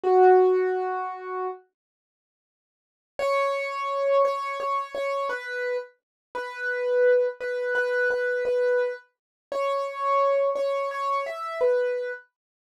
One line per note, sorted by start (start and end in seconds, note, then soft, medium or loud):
0.04 1.47 F#4 medium
3.19 4.22 C#5 medium
4.25 4.58 C#5 medium
4.60 4.93 C#5 medium
4.95 5.28 C#5 medium
5.29 5.76 B4 medium
6.35 7.27 B4 medium
7.41 7.74 B4 medium
7.75 8.08 B4 medium
8.11 8.44 B4 medium
8.45 8.93 B4 medium
9.52 10.49 C#5 medium
10.55 10.89 C#5 medium
10.91 11.24 C#5 medium
11.26 11.60 E5 medium
11.61 12.11 B4 medium